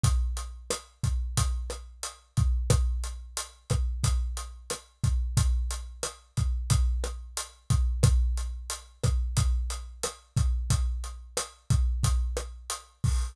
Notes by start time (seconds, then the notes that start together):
0.03 kick, closed hi-hat
0.37 closed hi-hat
0.70 cross-stick, closed hi-hat
1.03 kick, closed hi-hat
1.37 kick, closed hi-hat
1.70 cross-stick, closed hi-hat
2.03 closed hi-hat
2.37 kick, closed hi-hat
2.70 kick, cross-stick, closed hi-hat
3.04 closed hi-hat
3.37 closed hi-hat
3.70 kick, cross-stick, closed hi-hat
4.03 kick, closed hi-hat
4.37 closed hi-hat
4.70 cross-stick, closed hi-hat
5.03 kick, closed hi-hat
5.37 kick, closed hi-hat
5.71 closed hi-hat
6.03 cross-stick, closed hi-hat
6.37 kick, closed hi-hat
6.70 kick, closed hi-hat
7.04 cross-stick, closed hi-hat
7.37 closed hi-hat
7.70 kick, closed hi-hat
8.03 kick, cross-stick, closed hi-hat
8.37 closed hi-hat
8.70 closed hi-hat
9.03 kick, cross-stick, closed hi-hat
9.37 kick, closed hi-hat
9.70 closed hi-hat
10.03 cross-stick, closed hi-hat
10.37 kick, closed hi-hat
10.70 kick, closed hi-hat
11.04 closed hi-hat
11.37 cross-stick, closed hi-hat
11.70 kick, closed hi-hat
12.03 kick, closed hi-hat
12.37 cross-stick, closed hi-hat
12.70 closed hi-hat
13.04 kick, open hi-hat